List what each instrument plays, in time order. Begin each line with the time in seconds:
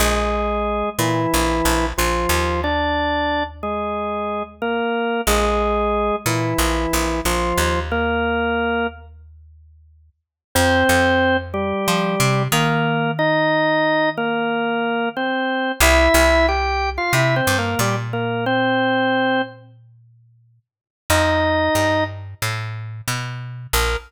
0.00 electric bass (finger) A#1, drawbar organ G#3 G#4
0.99 electric bass (finger) A#2, drawbar organ E3 E4
1.34 electric bass (finger) A#1
1.65 electric bass (finger) A#1
1.98 electric bass (finger) A#1, drawbar organ F3 F4
2.29 electric bass (finger) D#2
2.64 drawbar organ D4 D5
3.63 drawbar organ G#3 G#4
4.62 drawbar organ A#3 A#4
5.27 electric bass (finger) A#1, drawbar organ G#3 G#4
6.26 electric bass (finger) A#2, drawbar organ E3 E4
6.58 electric bass (finger) A#1
6.93 electric bass (finger) A#1
7.25 electric bass (finger) A#1, drawbar organ F3 F4
7.58 electric bass (finger) D#2
7.91 drawbar organ A#3 A#4
10.55 electric bass (finger) F2, drawbar organ C4 C5
10.89 electric bass (finger) F2
11.54 drawbar organ G3 G4
11.88 electric bass (finger) F3
12.20 electric bass (finger) C3
12.52 electric bass (finger) D#3, drawbar organ A#3 A#4
13.19 drawbar organ D#4 D#5
14.17 drawbar organ A#3 A#4
15.16 drawbar organ C4 C5
15.80 electric bass (finger) C2, drawbar organ E4 E5
16.14 electric bass (finger) C2
16.48 drawbar organ G4 G5
16.98 drawbar organ F4 F5
17.13 electric bass (finger) C3, drawbar organ E4 E5
17.36 drawbar organ C4 C5
17.47 electric bass (finger) G2
17.58 drawbar organ A#3 A#4
17.79 electric bass (finger) A#2, drawbar organ G3 G4
18.13 drawbar organ A#3 A#4
18.46 drawbar organ C4 C5
21.10 electric bass (finger) F2, drawbar organ D#4 D#5
21.75 electric bass (finger) G2
22.42 electric bass (finger) A2
23.08 electric bass (finger) B2
23.73 electric bass (finger) A#1, drawbar organ A#4